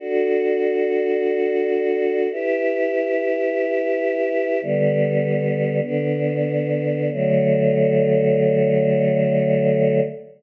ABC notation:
X:1
M:2/2
L:1/8
Q:1/2=52
K:D
V:1 name="Choir Aahs"
[DFA]8 | [EGB]8 | "^rit." [D,G,B,]4 [D,B,D]4 | [D,F,A,]8 |]